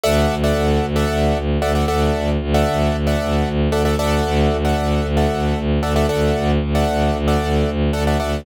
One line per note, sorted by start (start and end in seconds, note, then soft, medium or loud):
0.04 0.26 D2 medium
0.04 0.35 A4 medium
0.04 0.35 D5 loud
0.04 0.35 E5 loud
0.04 0.35 F#5 loud
0.30 0.52 D2 medium
0.44 0.86 A4 medium
0.44 0.86 D5 medium
0.44 0.86 E5 medium
0.44 0.86 F#5 loud
0.56 0.79 D2 medium
0.82 1.05 D2 medium
0.96 1.38 A4 medium
0.96 1.38 D5 medium
0.96 1.38 E5 loud
0.96 1.38 F#5 medium
1.10 1.32 D2 medium
1.35 1.58 D2 medium
1.62 1.84 D2 medium
1.62 1.72 A4 medium
1.62 1.72 D5 medium
1.62 1.72 E5 medium
1.62 1.72 F#5 medium
1.75 1.86 A4 medium
1.75 1.86 D5 medium
1.75 1.86 E5 medium
1.75 1.86 F#5 medium
1.88 2.11 D2 medium
1.88 2.30 A4 medium
1.88 2.30 D5 medium
1.88 2.30 E5 medium
1.88 2.30 F#5 medium
2.15 2.37 D2 medium
2.41 2.63 D2 medium
2.54 2.96 A4 medium
2.54 2.96 D5 medium
2.54 2.96 E5 loud
2.54 2.96 F#5 medium
2.67 2.90 D2 medium
2.93 3.15 D2 medium
3.07 3.49 A4 medium
3.07 3.49 D5 medium
3.07 3.49 E5 medium
3.07 3.49 F#5 medium
3.21 3.43 D2 medium
3.46 3.68 D2 medium
3.72 3.95 D2 medium
3.72 3.83 A4 loud
3.72 3.83 D5 medium
3.72 3.83 E5 medium
3.72 3.83 F#5 medium
3.85 3.96 A4 medium
3.85 3.96 D5 medium
3.85 3.96 E5 loud
3.85 3.96 F#5 medium
3.99 4.21 D2 medium
3.99 4.57 A4 loud
3.99 4.57 D5 loud
3.99 4.57 E5 medium
3.99 4.57 F#5 loud
4.26 4.48 D2 medium
4.51 4.73 D2 medium
4.65 5.07 A4 medium
4.65 5.07 D5 medium
4.65 5.07 E5 medium
4.65 5.07 F#5 medium
4.78 5.00 D2 medium
5.04 5.26 D2 medium
5.17 5.59 A4 medium
5.17 5.59 D5 medium
5.17 5.59 E5 medium
5.17 5.59 F#5 medium
5.31 5.53 D2 medium
5.56 5.79 D2 medium
5.83 6.06 D2 medium
5.83 5.93 A4 medium
5.83 5.93 D5 medium
5.83 5.93 E5 medium
5.83 5.93 F#5 medium
5.96 6.06 A4 medium
5.96 6.06 D5 loud
5.96 6.06 E5 medium
5.96 6.06 F#5 medium
6.09 6.31 D2 medium
6.09 6.51 A4 medium
6.09 6.51 D5 medium
6.09 6.51 E5 medium
6.09 6.51 F#5 medium
6.36 6.58 D2 medium
6.62 6.84 D2 medium
6.75 7.17 A4 medium
6.75 7.17 D5 medium
6.75 7.17 E5 medium
6.75 7.17 F#5 loud
6.88 7.10 D2 medium
7.14 7.37 D2 medium
7.28 7.70 A4 medium
7.28 7.70 D5 loud
7.28 7.70 E5 medium
7.28 7.70 F#5 medium
7.41 7.64 D2 medium
7.68 7.90 D2 medium
7.93 8.16 D2 medium
7.93 8.04 A4 loud
7.93 8.04 D5 medium
7.93 8.04 E5 medium
7.93 8.04 F#5 medium
8.07 8.18 A4 medium
8.07 8.18 D5 medium
8.07 8.18 E5 medium
8.07 8.18 F#5 medium
8.20 8.43 D2 medium
8.20 8.41 A4 medium
8.20 8.41 D5 medium
8.20 8.41 E5 medium
8.20 8.41 F#5 medium